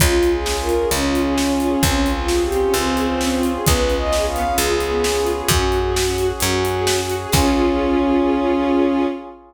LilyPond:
<<
  \new Staff \with { instrumentName = "Violin" } { \time 12/8 \key des \lydian \tempo 4. = 131 f'4 aes'4 bes'4 des'2. | des'4 f'4 g'4 c'2. | ces''4 ees''4 f''4 aes'2. | ges'2. ges'2 r4 |
des'1. | }
  \new Staff \with { instrumentName = "String Ensemble 1" } { \time 12/8 \key des \lydian des'8 f'8 aes'8 des'8 f'8 aes'8 des'8 f'8 aes'8 des'8 f'8 aes'8 | c'8 des'8 f'8 aes'8 c'8 des'8 f'8 aes'8 c'8 des'8 f'8 aes'8 | ces'8 des'8 f'8 aes'8 ces'8 des'8 f'8 aes'8 ces'8 des'8 f'8 aes'8 | des'8 ges'8 aes'8 des'8 ges'8 aes'8 des'8 ges'8 aes'8 des'8 ges'8 aes'8 |
<des' f' aes'>1. | }
  \new Staff \with { instrumentName = "Electric Bass (finger)" } { \clef bass \time 12/8 \key des \lydian des,2. des,2. | des,2. des,2. | des,2. des,2. | ges,2. ges,2. |
des,1. | }
  \new Staff \with { instrumentName = "Brass Section" } { \time 12/8 \key des \lydian <des' f' aes'>1. | <c' des' f' aes'>1. | <ces' des' f' aes'>1. | <des' ges' aes'>1. |
<des' f' aes'>1. | }
  \new DrumStaff \with { instrumentName = "Drums" } \drummode { \time 12/8 <hh bd>8. hh8. sn8. hh8. hh8. hh8. sn8. hh8. | <hh bd>8. hh8. sn8. hh8. hh8. hh8. sn8. hh8. | <hh bd>8. hh8. sn8. hh8. hh8. hh8. sn8. hh8. | <hh bd>8. hh8. sn8. hh8. hh8. hh8. sn8. hh8. |
<cymc bd>4. r4. r4. r4. | }
>>